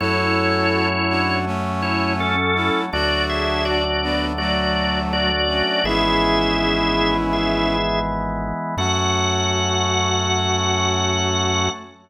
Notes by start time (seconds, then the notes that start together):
0.00 F#2 F#3 A3 C#4 E4 F#4 A4 C#5
1.09 D4 F#4
1.46 A3 C#4
1.82 E4 C#5
2.20 C#4 A4
2.56 C#4 E4
2.93 D2 F#3 A3 D4 F#4 D5
3.29 G#4 E5
3.65 F#4 D5
4.03 B3 D4
4.38 F#3 A3 F#4 D5
5.13 F#4 D5
5.48 A3 C#4
5.84 G#1 E3 G#3 B3 C#4 E4 G#4 E5
7.33 G#4 E5
8.77 F#2 F#3 A3 C#4 F#4 F#5